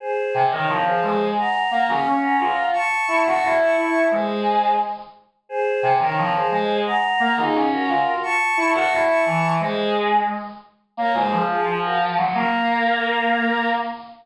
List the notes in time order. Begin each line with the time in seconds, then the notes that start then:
0.00 G#4 C5
0.34 C3
0.51 D#3 A#4 C#5
0.69 F3
0.85 G#4 C5
1.02 G#3
1.38 F#5 A#5
1.71 A#3
1.88 C#4 F5 G#5
2.06 C#4
2.22 F#5 A#5
2.40 F4
2.73 A5 C#6
3.08 E4
3.26 F#4 A5 C#6
3.43 E4
3.60 A5 C#6
3.77 E4
4.11 G#3 G#4 C5
5.49 G#4 C5
5.83 C3
6.00 D#3 A#4 C#5
6.17 F3
6.35 G#4 C5
6.51 G#3
6.86 F#5 A#5
7.20 A#3
7.37 D#4 F4 G#4
7.54 C#4
7.72 F#4 A#4
7.88 F4
8.23 A5 C#6
8.57 E4
8.74 F#4 A5 C#6
8.91 E4
9.08 A5 C#6
9.25 E3
9.60 G#3 G#4 C5
10.97 A#3 A#4 C#5
11.14 G#3 G#4 C5
11.32 F3
11.48 F4 G#4
11.66 F3
11.84 F#4 A#4
12.17 F#3
12.34 A#3 A#4